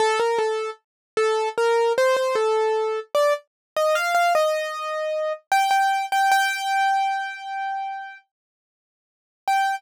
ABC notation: X:1
M:4/4
L:1/16
Q:1/4=76
K:Gm
V:1 name="Acoustic Grand Piano"
A B A2 z2 A2 B2 c c A4 | d z2 e f f e6 g g2 g | g10 z6 | g4 z12 |]